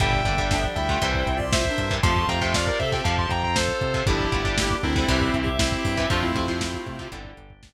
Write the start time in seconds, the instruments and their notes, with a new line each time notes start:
0.00 synth bass 1 G1, clarinet A#2 G3, overdriven guitar D3 G3, drawbar organ D4 G4, distortion guitar E5 G5, kick, closed hi-hat
0.13 kick
0.25 synth bass 1 G1, overdriven guitar D3 G3, clarinet D3 A#3, kick, closed hi-hat
0.38 overdriven guitar D3 G3, kick
0.51 clarinet F3 D4, kick, snare
0.64 kick
0.76 synth bass 1 D2, clarinet G3 E4, distortion guitar E5 G5, kick, closed hi-hat
0.89 overdriven guitar D3 G3, clarinet A3 F4, kick
1.02 synth bass 1 C2, overdriven guitar C3 E3 G3, drawbar organ C4 E4 G4, clarinet E4 C5, kick, closed hi-hat
1.15 kick
1.26 synth bass 1 C2, kick, closed hi-hat
1.36 clarinet F4 D5, kick
1.53 distortion guitar C5 E5, kick, snare
1.65 clarinet D4 A#4, kick
1.78 synth bass 1 G2, kick, closed hi-hat
1.91 overdriven guitar C3 E3 G3, kick
2.03 synth bass 1 F2, overdriven guitar C3 F3, clarinet A3 F4, drawbar organ C4 F4, distortion guitar A5 C6, kick, closed hi-hat
2.16 kick
2.28 synth bass 1 F2, overdriven guitar C3 F3, distortion guitar G5 A#5, kick, closed hi-hat
2.41 overdriven guitar C3 F3, distortion guitar E5 G5, kick
2.54 distortion guitar D5 F5, kick, snare
2.67 distortion guitar A#4 D5, kick
2.79 synth bass 1 C3, clarinet C4 A4, distortion guitar C5 E5, kick, closed hi-hat
2.92 overdriven guitar C3 F3, distortion guitar E5 G5, kick
3.04 synth bass 1 F2, overdriven guitar C3 F3, drawbar organ C4 F4, distortion guitar F5 A5, kick, closed hi-hat
3.18 distortion guitar A5 C6, kick
3.29 synth bass 1 F2, distortion guitar G5 A#5, kick, closed hi-hat
3.43 distortion guitar G5 A#5, kick
3.56 distortion guitar A4 C5, kick, snare
3.69 kick
3.81 synth bass 1 C3, kick, closed hi-hat
3.94 overdriven guitar C3 F3, kick
4.06 synth bass 1 G1, overdriven guitar D3 G3, clarinet F3 D4, drawbar organ D4 G4, distortion guitar E4 G4, kick, closed hi-hat
4.19 kick
4.32 synth bass 1 G1, overdriven guitar D3 G3, clarinet A3 F4, kick, closed hi-hat
4.45 overdriven guitar D3 G3, kick
4.58 clarinet A#3 G4, kick, snare
4.70 kick
4.82 synth bass 1 D2, distortion guitar C4 E4, clarinet D4 A#4, kick, closed hi-hat
4.96 overdriven guitar D3 G3, clarinet E4 C5, kick
5.08 synth bass 1 C2, overdriven guitar C3 E3 G3, drawbar organ C4 E4 G4, clarinet G4 E5, kick, closed hi-hat
5.21 kick
5.34 synth bass 1 C2, kick, closed hi-hat
5.42 clarinet G4 E5
5.47 kick
5.59 distortion guitar C4 E4, kick, snare
5.72 kick
5.77 clarinet G4 E5
5.85 synth bass 1 G2, kick, open hi-hat
5.97 overdriven guitar C3 E3 G3, kick
6.10 synth bass 1 F2, overdriven guitar C3 F3, clarinet A3 F4, drawbar organ C4 F4, distortion guitar D4 F4, kick, closed hi-hat
6.22 distortion guitar C4 E4, kick
6.34 synth bass 1 F2, overdriven guitar C3 F3, kick, closed hi-hat
6.48 overdriven guitar C3 F3, kick
6.61 kick, snare
6.74 kick
6.86 synth bass 1 C3, kick, closed hi-hat
6.99 overdriven guitar C3 F3, kick
7.12 synth bass 1 G1, overdriven guitar D3 G3, drawbar organ D4 G4, kick, closed hi-hat
7.25 kick
7.37 synth bass 1 G1, kick, closed hi-hat
7.50 kick
7.63 kick, snare